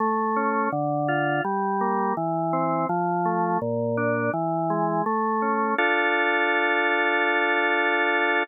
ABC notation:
X:1
M:4/4
L:1/8
Q:1/4=83
K:Dm
V:1 name="Drawbar Organ"
A, ^C D, F G, B, E, =C | F, A, B,, D E, ^G, A, ^C | [DFA]8 |]